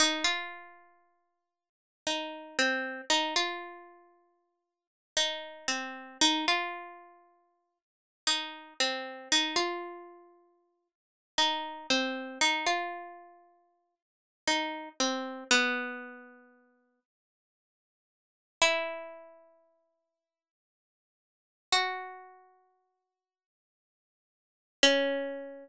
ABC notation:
X:1
M:3/4
L:1/16
Q:1/4=58
K:Cdor
V:1 name="Pizzicato Strings"
E F6 z E2 C2 | E F6 z E2 C2 | E F6 z E2 C2 | E F6 z E2 C2 |
E F6 z E2 C2 | =B,6 z6 | [K:C#dor] E12 | F8 z4 |
C12 |]